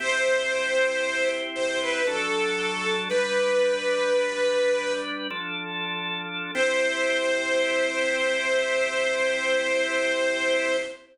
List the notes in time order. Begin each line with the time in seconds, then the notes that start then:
0.00 C4 E4 G4 C5
1.55 C5
1.81 B4
2.07 F#3 D4 A4
3.09 G3 D4 B4
5.30 F3 D4 A4
6.54 C4 E4 G4 C5